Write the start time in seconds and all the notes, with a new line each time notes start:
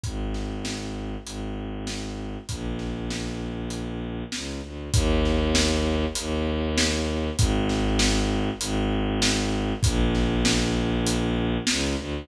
0.03 G#1, kick, closed hi-hat
0.34 snare
0.65 snare
1.24 G#1, closed hi-hat
1.87 snare
2.49 A#1, kick, closed hi-hat
2.79 snare
3.10 snare
3.70 closed hi-hat
4.32 C#2, snare
4.62 D2
4.93 D#2, kick, closed hi-hat
5.25 snare
5.55 snare
6.15 D#2, closed hi-hat
6.78 snare
7.37 G#1, kick, closed hi-hat
7.69 snare
7.99 snare
8.60 G#1, closed hi-hat
9.22 snare
9.83 A#1, kick, closed hi-hat
10.15 snare
10.45 snare
11.07 closed hi-hat
11.67 C#2, snare
11.97 D2